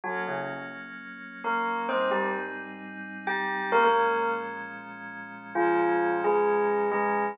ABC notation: X:1
M:4/4
L:1/16
Q:1/4=131
K:Bbm
V:1 name="Tubular Bells"
[G,G]2 [D,D]2 z8 [B,B]4 | [Cc]2 [=G,=G]2 z8 [G=g]4 | [B,B] [B,B]5 z10 | [F,F]6 [A,A]6 [A,A]4 |]
V:2 name="Pad 5 (bowed)"
[G,B,D]16 | [A,,=G,CE]16 | [B,,F,A,D]16 | [B,,F,A,D]16 |]